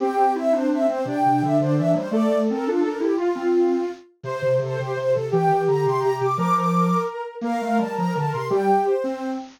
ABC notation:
X:1
M:6/8
L:1/8
Q:3/8=113
K:Cmix
V:1 name="Ocarina"
g2 e c e c | g2 e c e c | d2 B F B G | F5 z |
c2 A G c A | g2 b c' b d' | d' d'3 z2 | f2 a b a c' |
g2 c3 z |]
V:2 name="Ocarina"
C6 | D6 | A6 | F4 z2 |
c6 | G6 | B6 | B6 |
G3 z3 |]
V:3 name="Ocarina"
G G E D D C | C, C, D, D, E, G, | A, A, C D D E | F C3 z2 |
C, C, C, C, C, C, | E, E, D, C, C, C, | F,3 z3 | B, A, G, F, D, C, |
G, z2 C2 z |]